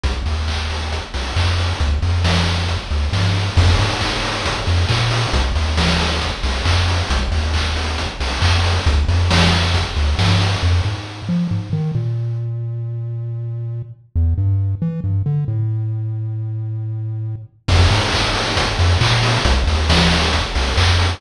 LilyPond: <<
  \new Staff \with { instrumentName = "Synth Bass 1" } { \clef bass \time 4/4 \key f \major \tempo 4 = 136 c,8 ees,2 c,8 f,4 | d,8 f,2 d,8 g,4 | f,8 aes,2 f,8 bes,4 | c,8 ees,2 c,8 f,4 |
c,8 ees,2 c,8 f,4 | d,8 f,2 d,8 g,4 | f,8 aes,4 f8 aes,8 ees8 bes,4~ | bes,1 |
e,8 g,4 e8 g,8 d8 a,4~ | a,1 | f,8 aes,2 f,8 bes,4 | c,8 ees,2 c,8 f,4 | }
  \new DrumStaff \with { instrumentName = "Drums" } \drummode { \time 4/4 <hh bd>8 hho8 <hc bd>8 hho8 <hh bd>8 hho8 <hc bd>8 hho8 | <hh bd>8 hho8 <bd sn>8 hho8 <hh bd>8 hho8 <bd sn>8 hho8 | <cymc bd>8 hho8 <hc bd>8 hho8 <hh bd>8 hho8 <hc bd>8 hho8 | <hh bd>8 hho8 <bd sn>8 hho8 <hh bd>8 hho8 <hc bd>8 hho8 |
<hh bd>8 hho8 <hc bd>8 hho8 <hh bd>8 hho8 <hc bd>8 hho8 | <hh bd>8 hho8 <bd sn>8 hho8 <hh bd>8 hho8 <bd sn>8 hho8 | r4 r4 r4 r4 | r4 r4 r4 r4 |
r4 r4 r4 r4 | r4 r4 r4 r4 | <cymc bd>8 hho8 <hc bd>8 hho8 <hh bd>8 hho8 <hc bd>8 hho8 | <hh bd>8 hho8 <bd sn>8 hho8 <hh bd>8 hho8 <hc bd>8 hho8 | }
>>